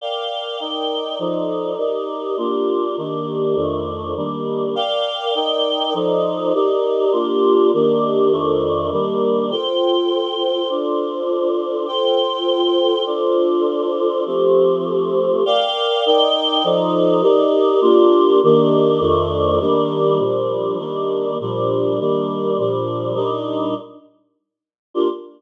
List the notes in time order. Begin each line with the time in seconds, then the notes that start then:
0.01 A#4 D5 F5 G5
0.60 D#4 A#4 D5 G5
1.19 F3 D#4 A4 D5
1.78 D#4 G4 A#4 D5
2.37 A#3 D4 F4 G4
2.97 D#3 A#3 D4 G4
3.55 F2 D#3 A3 D4
4.16 D#3 G3 A#3 D4
4.75 A#4 D5 F5 G5
5.35 D#4 A#4 D5 G5
5.94 F3 D#4 A4 D5
6.54 D#4 G4 A#4 D5
7.12 A#3 D4 F4 G4
7.73 D#3 A#3 D4 G4
8.32 F2 D#3 A3 D4
8.92 D#3 G3 A#3 D4
9.51 F4 A4 C5 G5
10.69 D4 F4 A4 C5
11.87 F4 A4 C5 G5
13.06 D4 F4 A4 C5
14.26 F3 A3 C4 G4
15.46 A#4 D5 F5 G5
16.06 D#4 A#4 D5 G5
16.64 F3 D#4 A4 D5
17.22 D#4 G4 A#4 D5
17.81 A#3 D4 F4 G4
18.43 D#3 A#3 D4 G4
19.00 F2 D#3 A3 D4
19.60 D#3 G3 A#3 D4
20.19 A#2 F3 G3 D4
20.78 D#3 G3 A#3 D4
21.40 A#2 F3 G3 D4
21.99 D#3 G3 A#3 D4
22.58 A#2 F3 G3 D4
23.15 A#2 G3 D4 D#4
24.94 A#3 D4 F4 G4